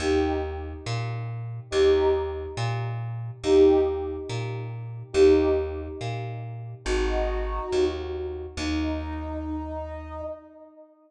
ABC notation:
X:1
M:4/4
L:1/8
Q:"Swing" 1/4=140
K:Eb
V:1 name="Brass Section"
[EG]2 z6 | [EG]2 z6 | [EG]2 z6 | [EG]2 z6 |
[E_G]5 z3 | E8 |]
V:2 name="Electric Bass (finger)" clef=bass
E,,4 B,,4 | E,,4 B,,4 | E,,4 B,,4 | E,,4 B,,4 |
A,,,4 E,,4 | E,,8 |]